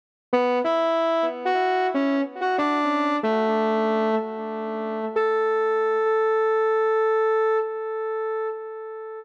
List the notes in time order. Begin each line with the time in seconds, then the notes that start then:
0.33 B3 B4
0.64 E4 E5
1.45 F#4 F#5
1.94 C#4 C#5
2.41 F#4 F#5
2.58 D4 D5
3.23 A3 A4
5.16 A4